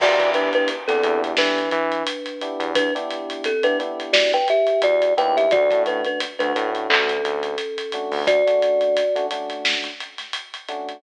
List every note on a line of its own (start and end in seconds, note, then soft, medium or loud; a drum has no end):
0.00 0.17 E2 medium
0.00 0.16 B3 medium
0.00 0.16 D4 loud
0.00 0.16 E4 loud
0.00 0.30 F#4 medium
0.00 0.16 G4 loud
0.00 0.30 D5 medium
0.00 kick loud
0.00 crash loud
0.19 0.49 E3 medium
0.19 0.73 B3 medium
0.19 0.73 D4 medium
0.19 0.73 E4 medium
0.19 0.73 G4 medium
0.19 kick medium
0.19 closed hi-hat medium
0.34 0.53 D4 medium
0.34 0.53 B4 medium
0.34 closed hi-hat medium
0.53 0.69 D4 medium
0.53 0.69 B4 loud
0.53 closed hi-hat medium
0.68 closed hi-hat loud
0.88 1.02 E2 medium
0.88 1.01 B3 medium
0.88 1.20 C4 medium
0.88 1.01 D4 medium
0.88 1.01 E4 medium
0.88 1.01 G4 medium
0.88 1.20 A4 medium
0.88 snare soft
0.88 closed hi-hat medium
1.03 1.34 E2 medium
1.03 1.60 B3 medium
1.03 1.60 D4 medium
1.03 1.60 E4 medium
1.03 1.60 G4 medium
1.03 closed hi-hat medium
1.24 closed hi-hat medium
1.37 1.69 E3 medium
1.37 2.71 D4 medium
1.37 2.71 B4 medium
1.37 snare loud
1.58 closed hi-hat medium
1.71 2.03 E3 medium
1.71 closed hi-hat medium
1.92 closed hi-hat medium
2.07 closed hi-hat loud
2.26 closed hi-hat medium
2.41 2.84 B3 medium
2.41 2.84 D4 medium
2.41 2.84 E4 medium
2.41 2.84 G4 medium
2.41 closed hi-hat medium
2.60 2.90 E2 medium
2.60 closed hi-hat medium
2.75 2.94 D4 loud
2.75 2.94 B4 loud
2.75 kick loud
2.75 closed hi-hat loud
2.95 3.49 B3 medium
2.95 3.49 D4 loud
2.95 3.49 E4 medium
2.95 3.49 G4 medium
2.95 closed hi-hat medium
3.10 closed hi-hat medium
3.30 closed hi-hat medium
3.44 3.64 C4 medium
3.44 3.64 A4 medium
3.44 closed hi-hat loud
3.63 3.76 B3 loud
3.63 3.76 D4 medium
3.63 3.78 D4 medium
3.63 3.76 E4 medium
3.63 3.76 G4 medium
3.63 3.78 B4 loud
3.63 closed hi-hat medium
3.79 4.36 B3 medium
3.79 4.36 D4 medium
3.79 4.36 E4 medium
3.79 4.36 G4 medium
3.79 closed hi-hat medium
4.00 closed hi-hat medium
4.13 4.31 F#4 medium
4.13 4.31 D5 medium
4.13 snare loud
4.33 4.48 B4 medium
4.33 4.48 G5 loud
4.33 closed hi-hat medium
4.48 4.81 G4 medium
4.48 4.81 E5 medium
4.48 closed hi-hat medium
4.67 closed hi-hat medium
4.82 5.13 E2 medium
4.82 5.14 F#4 medium
4.82 5.14 D5 loud
4.82 closed hi-hat loud
5.02 closed hi-hat medium
5.17 5.49 D#2 medium
5.17 5.46 B3 medium
5.17 5.46 D4 medium
5.17 5.46 E4 loud
5.17 5.46 G4 medium
5.17 5.36 B4 medium
5.17 5.36 G5 loud
5.17 closed hi-hat medium
5.37 5.52 G4 medium
5.37 5.52 E5 medium
5.37 closed hi-hat medium
5.51 5.69 D2 medium
5.51 5.67 A3 medium
5.51 5.67 C#4 loud
5.51 5.67 D4 medium
5.51 5.67 F#4 loud
5.51 5.82 F#4 medium
5.51 5.82 D5 loud
5.51 kick loud
5.51 closed hi-hat medium
5.71 6.02 A2 medium
5.71 6.24 A3 medium
5.71 6.24 C#4 medium
5.71 6.24 D4 medium
5.71 6.24 F#4 medium
5.71 kick medium
5.71 closed hi-hat medium
5.86 6.05 D4 medium
5.86 6.05 B4 medium
5.86 closed hi-hat medium
6.05 6.21 D4 medium
6.05 6.21 B4 medium
6.05 closed hi-hat medium
6.20 closed hi-hat loud
6.39 6.53 D2 medium
6.39 6.52 A3 medium
6.39 6.52 C#4 medium
6.39 6.70 D4 medium
6.39 6.52 D4 medium
6.39 6.52 F#4 medium
6.39 6.70 B4 medium
6.39 closed hi-hat medium
6.55 6.87 A2 medium
6.55 7.12 A3 medium
6.55 7.12 C#4 medium
6.55 7.12 D4 medium
6.55 7.12 F#4 medium
6.55 closed hi-hat medium
6.75 closed hi-hat medium
6.90 7.21 D2 medium
6.90 8.23 C#4 medium
6.90 8.23 A4 medium
6.90 clap loud
7.09 closed hi-hat medium
7.24 7.56 D2 medium
7.24 closed hi-hat medium
7.43 closed hi-hat medium
7.58 closed hi-hat medium
7.78 closed hi-hat medium
7.92 8.36 A3 medium
7.92 8.36 C#4 medium
7.92 8.36 D4 medium
7.92 8.36 F#4 medium
7.92 closed hi-hat medium
8.11 8.42 D2 medium
8.11 open hi-hat medium
8.27 9.26 F#4 medium
8.27 9.26 D5 loud
8.27 kick loud
8.27 closed hi-hat loud
8.47 9.00 A3 medium
8.47 9.00 C#4 medium
8.47 9.00 D4 medium
8.47 9.00 F#4 medium
8.47 closed hi-hat medium
8.62 closed hi-hat medium
8.81 closed hi-hat medium
8.97 closed hi-hat loud
9.16 9.28 A3 loud
9.16 9.28 C#4 medium
9.16 9.28 D4 medium
9.16 9.28 F#4 medium
9.16 closed hi-hat medium
9.31 9.88 A3 medium
9.31 9.88 C#4 medium
9.31 9.88 D4 medium
9.31 9.88 F#4 medium
9.31 closed hi-hat medium
9.50 closed hi-hat medium
9.65 snare loud
9.84 closed hi-hat medium
10.00 closed hi-hat medium
10.18 snare soft
10.18 closed hi-hat medium
10.33 closed hi-hat loud
10.54 closed hi-hat medium
10.69 10.97 A3 medium
10.69 10.97 C#4 medium
10.69 10.97 D4 medium
10.69 10.97 F#4 medium
10.69 closed hi-hat medium
10.89 closed hi-hat medium